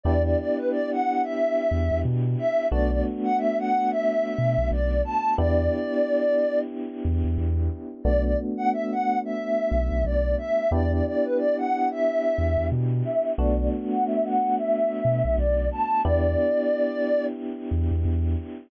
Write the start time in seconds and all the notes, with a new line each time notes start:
0.04 E2 B3 D4 E4 G4 D5
0.25 D5
0.38 D5
0.57 B4
0.71 D5
0.92 F#5
1.24 E5
1.71 E2
1.91 E2
2.05 B2
2.39 E5
2.71 B1 A3 B3 D4 F#4 D5
2.91 D5
3.24 F#5
3.38 E5
3.59 F#5
3.91 E5
4.38 B2
4.58 B1
4.71 B1 D5
5.05 A5
5.38 E2 B3 D4 E4 G4 D5
7.05 E2
7.25 E2
7.38 E2
8.04 B1 A3 B3 D4 F#4 D5
8.24 D5
8.57 F#5
8.73 E5
8.92 F#5
9.25 E5
9.71 B1
9.91 B1
10.05 B1 D5
10.38 E5
10.71 E2 B3 D4 E4 G4 D5
10.92 D5
11.06 D5
11.25 B4
11.38 D5
11.58 F#5
11.91 E5
12.38 E2
12.58 E2
12.72 B2
13.05 E5
13.37 B1 A3 B3 D4 F#4 D5
13.58 D5
13.91 F#5
14.06 E5
14.25 F#5
14.58 E5
15.05 B2
15.25 B1
15.38 B1 D5
15.72 A5
16.04 E2 B3 D4 E4 G4 D5
17.71 E2
17.91 E2
18.05 E2